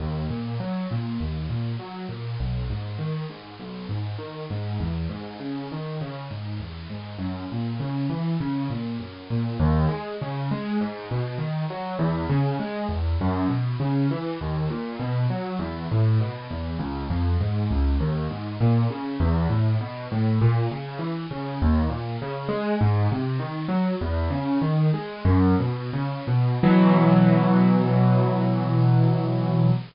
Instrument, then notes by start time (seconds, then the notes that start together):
acoustic grand piano
0.00 D#2
0.30 A#2
0.60 F#3
0.91 A#2
1.20 D#2
1.50 A#2
1.79 F#3
2.09 A#2
2.40 B1
2.70 G#2
2.98 D#3
3.30 G#2
3.60 B1
3.89 G#2
4.18 D#3
4.50 G#2
4.80 E2
5.09 G#2
5.40 C#3
5.72 D#3
6.01 C#3
6.31 G#2
6.60 E2
6.90 G#2
7.19 F#2
7.52 A#2
7.80 C#3
8.10 E3
8.40 C#3
8.70 A#2
9.00 F#2
9.30 A#2
9.60 D#2
9.89 G#3
10.21 C#3
10.51 G#3
10.81 G#2
11.11 B2
11.38 D#3
11.70 F#3
11.99 E2
12.29 C#3
12.60 G#3
12.89 E2
13.21 F#2
13.49 B2
13.80 C#3
14.11 E3
14.41 D#2
14.70 A#2
15.00 B2
15.30 F#3
15.59 E2
15.91 A2
16.20 B2
16.50 E2
16.79 C#2
17.10 F2
17.41 G#2
17.71 C#2
18.00 D#2
18.31 G#2
18.61 A#2
18.90 C#3
19.20 E2
19.50 A2
19.81 B2
20.12 A2
20.41 A#2
20.71 C#3
20.99 E3
21.31 C#3
21.62 D#2
21.90 A#2
22.22 C#3
22.48 G#3
22.81 G#2
23.12 C3
23.39 D#3
23.68 F#3
24.01 E2
24.30 C#3
24.62 D#3
24.94 G#3
25.25 F#2
25.60 B2
25.93 C#3
26.27 B2
26.63 B2 E3 F#3